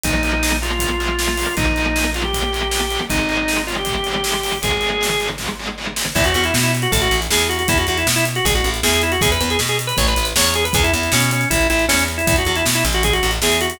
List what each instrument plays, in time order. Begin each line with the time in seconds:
0.04 electric bass (finger) A#1, overdriven guitar F3 A#3, drawbar organ D#4, kick, closed hi-hat
0.23 overdriven guitar F3 A#3, closed hi-hat
0.43 overdriven guitar F3 A#3, snare
0.62 overdriven guitar F3 A#3, drawbar organ F4, closed hi-hat
0.71 drawbar organ F4
0.79 overdriven guitar F3 A#3, kick, closed hi-hat
1.00 overdriven guitar F3 A#3, closed hi-hat
1.19 overdriven guitar F3 A#3, snare
1.38 overdriven guitar F3 A#3, open hi-hat
1.57 electric bass (finger) A#1, overdriven guitar F3 A#3, drawbar organ D#4, kick, closed hi-hat
1.76 overdriven guitar F3 A#3, closed hi-hat
1.96 overdriven guitar F3 A#3, snare
2.14 overdriven guitar F3 A#3, drawbar organ F4, closed hi-hat
2.24 drawbar organ G4
2.33 overdriven guitar F3 A#3, kick, closed hi-hat
2.53 overdriven guitar F3 A#3, closed hi-hat
2.71 overdriven guitar F3 A#3, snare
2.91 overdriven guitar F3 A#3, closed hi-hat
3.10 electric bass (finger) G#1, overdriven guitar D#3 G#3, drawbar organ D#4, kick, closed hi-hat
3.29 overdriven guitar D#3 G#3, closed hi-hat
3.48 overdriven guitar D#3 G#3, snare
3.67 overdriven guitar D#3 G#3, drawbar organ F4, closed hi-hat
3.78 drawbar organ G4
3.85 overdriven guitar D#3 G#3, kick, closed hi-hat
4.04 overdriven guitar D#3 G#3, closed hi-hat
4.24 overdriven guitar D#3 G#3, snare
4.43 overdriven guitar D#3 G#3, open hi-hat
4.62 electric bass (finger) G#1, overdriven guitar D#3 G#3, drawbar organ G#4, kick, closed hi-hat
4.81 overdriven guitar D#3 G#3, closed hi-hat
5.01 overdriven guitar D#3 G#3, snare
5.20 overdriven guitar D#3 G#3, closed hi-hat
5.38 overdriven guitar D#3 G#3, kick, snare
5.59 overdriven guitar D#3 G#3
5.78 overdriven guitar D#3 G#3
5.96 overdriven guitar D#3 G#3, snare
6.15 electric bass (finger) E2, drawbar organ E4, kick, crash
6.24 drawbar organ F#4, closed hi-hat
6.34 electric bass (finger) E2, drawbar organ F#4, closed hi-hat
6.44 drawbar organ E4, closed hi-hat
6.54 electric bass (finger) B2, snare
6.63 drawbar organ E4, closed hi-hat
6.75 closed hi-hat
6.82 drawbar organ F#4, closed hi-hat
6.92 electric bass (finger) A1, drawbar organ A4, kick, closed hi-hat
7.02 drawbar organ F#4, closed hi-hat
7.11 electric bass (finger) A1, closed hi-hat
7.22 closed hi-hat
7.30 electric bass (finger) E2, drawbar organ G#4, snare
7.40 closed hi-hat
7.49 drawbar organ F#4, closed hi-hat
7.59 drawbar organ F#4, closed hi-hat
7.68 electric bass (finger) E2, drawbar organ E4, kick, closed hi-hat
7.78 drawbar organ F#4, closed hi-hat
7.87 electric bass (finger) E2, drawbar organ F#4, closed hi-hat
7.98 drawbar organ E4, closed hi-hat
8.07 electric bass (finger) B2, snare
8.16 drawbar organ E4, closed hi-hat
8.26 closed hi-hat
8.35 drawbar organ F#4, closed hi-hat
8.45 electric bass (finger) A1, drawbar organ G#4, kick, closed hi-hat
8.55 drawbar organ F#4, closed hi-hat
8.64 electric bass (finger) A1, closed hi-hat
8.74 closed hi-hat
8.83 electric bass (finger) E2, drawbar organ G#4, snare
8.94 closed hi-hat
9.02 drawbar organ E4, closed hi-hat
9.12 drawbar organ F#4, closed hi-hat
9.21 electric bass (finger) E2, drawbar organ G#4, kick, closed hi-hat
9.32 drawbar organ B4, closed hi-hat
9.41 electric bass (finger) E2, drawbar organ B4, closed hi-hat
9.50 drawbar organ G#4, closed hi-hat
9.59 electric bass (finger) B2, snare
9.68 drawbar organ G#4, closed hi-hat
9.79 closed hi-hat
9.87 drawbar organ B4, closed hi-hat
9.97 electric bass (finger) A1, drawbar organ C#5, kick, closed hi-hat
10.08 drawbar organ B4, closed hi-hat
10.16 electric bass (finger) A1, closed hi-hat
10.25 closed hi-hat
10.36 electric bass (finger) E2, drawbar organ C#5, snare
10.44 closed hi-hat
10.54 drawbar organ G#4, closed hi-hat
10.65 drawbar organ B4, closed hi-hat
10.73 electric bass (finger) E2, drawbar organ G#4, kick, closed hi-hat
10.84 drawbar organ E4, closed hi-hat
10.93 electric bass (finger) E2, drawbar organ E4, closed hi-hat
11.03 closed hi-hat
11.12 electric bass (finger) B2, drawbar organ C#4, snare
11.21 closed hi-hat
11.31 drawbar organ C#4, closed hi-hat
11.41 closed hi-hat
11.50 electric bass (finger) A1, drawbar organ E4, kick, closed hi-hat
11.61 closed hi-hat
11.70 electric bass (finger) A1, drawbar organ E4, closed hi-hat
11.79 closed hi-hat
11.88 electric bass (finger) E2, drawbar organ C#4, snare
11.99 closed hi-hat
12.08 closed hi-hat
12.18 drawbar organ E4, closed hi-hat
12.27 electric bass (finger) E2, drawbar organ E4, kick, closed hi-hat
12.36 drawbar organ F#4, closed hi-hat
12.45 electric bass (finger) E2, drawbar organ F#4, closed hi-hat
12.56 drawbar organ E4, closed hi-hat
12.65 electric bass (finger) B2, snare
12.74 drawbar organ E4, closed hi-hat
12.85 electric bass (finger) A1, closed hi-hat
12.93 drawbar organ F#4, closed hi-hat
13.03 drawbar organ G#4, kick, closed hi-hat
13.13 drawbar organ F#4, closed hi-hat
13.23 electric bass (finger) A1, closed hi-hat
13.31 closed hi-hat
13.42 electric bass (finger) E2, drawbar organ G#4, snare
13.52 closed hi-hat
13.61 drawbar organ F#4, closed hi-hat
13.70 drawbar organ F#4, closed hi-hat